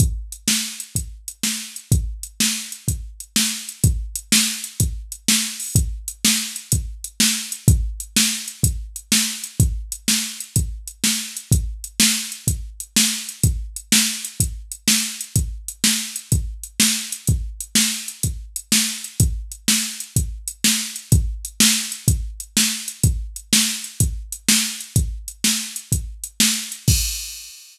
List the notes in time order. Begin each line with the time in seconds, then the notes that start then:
0.00 kick, closed hi-hat
0.32 closed hi-hat
0.48 snare
0.80 closed hi-hat
0.95 kick, closed hi-hat
1.28 closed hi-hat
1.43 snare
1.76 closed hi-hat
1.92 kick, closed hi-hat
2.23 closed hi-hat
2.40 snare
2.72 closed hi-hat
2.88 kick, closed hi-hat
3.20 closed hi-hat
3.36 snare
3.69 closed hi-hat
3.84 kick, closed hi-hat
4.16 closed hi-hat
4.32 snare
4.64 closed hi-hat
4.80 kick, closed hi-hat
5.12 closed hi-hat
5.28 snare
5.60 open hi-hat
5.75 kick, closed hi-hat
6.08 closed hi-hat
6.25 snare
6.56 closed hi-hat
6.72 kick, closed hi-hat
7.04 closed hi-hat
7.20 snare
7.52 closed hi-hat
7.68 kick, closed hi-hat
8.00 closed hi-hat
8.16 snare
8.48 closed hi-hat
8.63 kick, closed hi-hat
8.96 closed hi-hat
9.12 snare
9.44 closed hi-hat
9.60 kick, closed hi-hat
9.92 closed hi-hat
10.08 snare
10.40 closed hi-hat
10.56 kick, closed hi-hat
10.88 closed hi-hat
11.04 snare
11.37 closed hi-hat
11.52 kick, closed hi-hat
11.84 closed hi-hat
12.00 snare
12.32 closed hi-hat
12.47 kick, closed hi-hat
12.80 closed hi-hat
12.96 snare
13.29 closed hi-hat
13.43 kick, closed hi-hat
13.76 closed hi-hat
13.92 snare
14.25 closed hi-hat
14.40 kick, closed hi-hat
14.72 closed hi-hat
14.88 snare
15.21 closed hi-hat
15.36 kick, closed hi-hat
15.68 closed hi-hat
15.84 snare
16.16 closed hi-hat
16.32 kick, closed hi-hat
16.63 closed hi-hat
16.80 snare
17.12 closed hi-hat
17.27 kick, closed hi-hat
17.60 closed hi-hat
17.75 snare
18.08 closed hi-hat
18.23 kick, closed hi-hat
18.56 closed hi-hat
18.72 snare
19.04 closed hi-hat
19.20 kick, closed hi-hat
19.52 closed hi-hat
19.68 snare
20.00 closed hi-hat
20.16 kick, closed hi-hat
20.48 closed hi-hat
20.64 snare
20.96 closed hi-hat
21.12 kick, closed hi-hat
21.45 closed hi-hat
21.60 snare
21.92 closed hi-hat
22.08 kick, closed hi-hat
22.40 closed hi-hat
22.57 snare
22.88 closed hi-hat
23.03 kick, closed hi-hat
23.36 closed hi-hat
23.53 snare
23.84 closed hi-hat
24.00 kick, closed hi-hat
24.32 closed hi-hat
24.49 snare
24.81 closed hi-hat
24.96 kick, closed hi-hat
25.28 closed hi-hat
25.44 snare
25.76 closed hi-hat
25.92 kick, closed hi-hat
26.24 closed hi-hat
26.40 snare
26.72 closed hi-hat
26.88 kick, crash